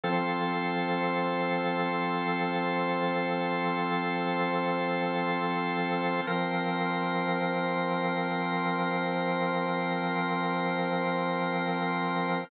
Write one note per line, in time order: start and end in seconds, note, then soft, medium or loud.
0.04 6.21 F3 medium
0.04 6.21 C4 medium
0.04 6.21 F4 medium
0.04 6.21 A4 medium
0.04 6.21 C5 medium
6.27 12.44 F3 medium
6.27 12.44 C4 medium
6.27 12.44 F4 medium
6.27 12.44 A#4 medium
6.27 12.44 C5 medium